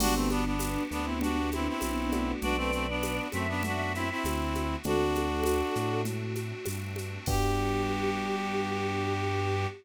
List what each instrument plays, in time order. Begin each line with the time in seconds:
0.00 synth bass 1 G1, electric piano 1 B3 D4 F#4 G4, pad 5 (bowed) B3 D4 F#4 G4, choir aahs B3 D4, clarinet D4 F#4, crash, low conga, shaker
0.15 clarinet A3 C4
0.30 clarinet B3 D4, high conga, shaker
0.45 clarinet B3 D4
0.59 tambourine, high conga, shaker
0.91 synth bass 1 D2, clarinet B3 D4, shaker
1.04 clarinet C4 E4
1.21 electric piano 1 B3 D4 F#4 G4, clarinet D4 F#4, low conga, shaker
1.52 clarinet C4 E4, high conga, shaker
1.68 clarinet C4 E4
1.81 synth bass 1 B1, tambourine, high conga, shaker
2.12 electric piano 1 A3 B3 D4 F#4, high conga, shaker
2.42 synth bass 1 B1, pad 5 (bowed) A3 B3 D4 F#4, clarinet D4 F#4, choir aahs B4 D5, low conga, shaker
2.57 clarinet A3 C4
2.72 clarinet A3 C4, shaker
2.89 clarinet B3 D4
3.03 tambourine, high conga, shaker
3.32 synth bass 1 F#2, clarinet A3 C4, choir aahs E5, high conga, shaker
3.48 clarinet B3 D4
3.63 electric piano 1 A3 B3 D4 F#4, clarinet D4 F#4, low conga, shaker
3.95 clarinet C4 E4, shaker
4.10 clarinet C4 E4
4.24 synth bass 1 D2, tambourine, high conga, shaker
4.55 high conga, shaker
4.83 synth bass 1 D2, electric piano 1 A3 C4 D4 F#4, pad 5 (bowed) A3 C4 D4 F#4, clarinet D4 F#4, choir aahs F#4 A4, low conga, shaker
5.15 high conga, shaker
5.43 tambourine, high conga, shaker
5.75 synth bass 1 A2, shaker
6.05 choir aahs F#4, low conga, shaker
6.35 high conga, shaker
6.66 synth bass 1 G2, tambourine, high conga, shaker
6.96 high conga, shaker
7.26 synth bass 1 G2, pad 5 (bowed) B3 D4 F#4 G4, electric piano 1 B3 D4 F#4 G4, choir aahs G4, clarinet G4, kick, crash